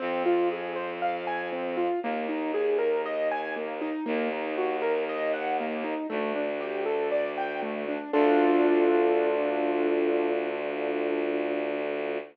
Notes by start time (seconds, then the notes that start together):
0.00 F2 C4
0.26 F4
0.52 G#4
0.76 C5
1.02 F5
1.27 G#5
1.52 C4
1.77 F4
2.03 D#2 A#3
2.29 D#4
2.54 G#4
2.79 A#4
3.06 D#5
3.31 G#5
3.56 A#3
3.81 D#4
4.06 D#2 A#3
4.32 D#4
4.58 F#4
4.82 A#4
5.09 D#5
5.33 F#5
5.60 A#3
5.84 D#4
6.10 D2 A3
6.36 D4
6.60 G4
6.86 A4
7.12 D5
7.37 G5
7.62 A3
7.88 D4
8.13 D2 D4 F4 A4